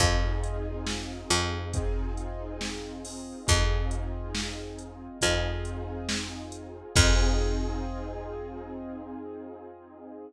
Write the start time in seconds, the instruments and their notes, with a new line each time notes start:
0.00 electric bass (finger) F2, acoustic grand piano C4 D#4 F4 G#4, kick, closed hi-hat
0.43 closed hi-hat
0.87 snare
1.30 electric bass (finger) F2, closed hi-hat
1.74 acoustic grand piano C4 D#4 F4 G#4, kick, closed hi-hat
2.17 closed hi-hat
2.61 snare
3.05 open hi-hat
3.47 electric bass (finger) F2, acoustic grand piano C4 D#4 F4 G#4, kick, closed hi-hat
3.91 closed hi-hat
4.35 snare
4.79 closed hi-hat
5.21 electric bass (finger) F2, acoustic grand piano C4 D#4 F4 G#4, kick, closed hi-hat
5.65 closed hi-hat
6.09 snare
6.52 closed hi-hat
6.95 electric bass (finger) F2, acoustic grand piano C4 D#4 F4 G#4, kick, crash